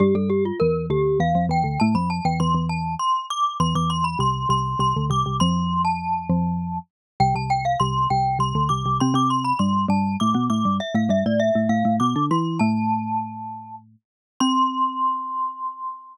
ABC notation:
X:1
M:3/4
L:1/16
Q:1/4=100
K:C
V:1 name="Glockenspiel"
G A G F _B2 G2 f2 g2 | a b a g c'2 a2 c'2 d'2 | c' d' c' b c'2 c'2 c'2 d'2 | c'3 a7 z2 |
g a g f c'2 g2 c'2 d'2 | c' d' c' b c'2 a2 d'2 d'2 | e f e d e2 f2 d'2 c'2 | a8 z4 |
c'12 |]
V:2 name="Xylophone"
[G,,G,] [G,,G,]3 [E,,E,]2 [D,,D,]2 [E,,E,] [F,,F,] [E,,E,] [D,,D,] | [A,,A,] [F,,F,]2 [E,,E,] [E,,E,] [E,,E,]3 z4 | [E,,E,] [E,,E,]3 [C,,C,]2 [C,,C,]2 [C,,C,] [D,,D,] [C,,C,] [C,,C,] | [F,,F,]6 [F,,F,]4 z2 |
[C,,C,] [C,,C,]3 [C,,C,]2 [C,,C,]2 [C,,C,] [D,,D,] [C,,C,] [C,,C,] | [C,C] [C,C]3 [G,,G,]2 [G,,G,]2 [A,,A,] [B,,B,] [A,,A,] [G,,G,] | z [A,,A,] [G,,G,] [A,,A,]2 [A,,A,] [A,,A,] [A,,A,] [B,,B,] [D,D] [E,E]2 | [A,,A,]10 z2 |
C12 |]